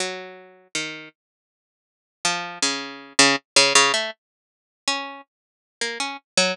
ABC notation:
X:1
M:7/8
L:1/16
Q:1/4=80
K:none
V:1 name="Harpsichord"
^F,4 ^D,2 z6 =F,2 | ^C,3 C, z C, C, A, z4 ^C2 | z3 ^A, ^C z ^F, z7 |]